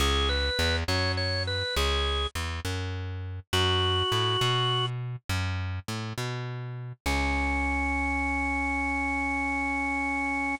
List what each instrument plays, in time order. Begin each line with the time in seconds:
0.00 electric bass (finger) C#2, drawbar organ G#4
0.29 drawbar organ B4
0.59 electric bass (finger) E2
0.88 electric bass (finger) F#2, drawbar organ C#5
1.17 drawbar organ C#5
1.47 drawbar organ B4
1.76 electric bass (finger) C#2, drawbar organ G#4
2.35 electric bass (finger) E2
2.65 electric bass (finger) F#2
3.53 electric bass (finger) F#2, drawbar organ F#4
4.12 electric bass (finger) A2
4.41 electric bass (finger) B2
5.29 electric bass (finger) F#2
5.88 electric bass (finger) A2
6.18 electric bass (finger) B2
7.06 electric bass (finger) C#2, drawbar organ C#4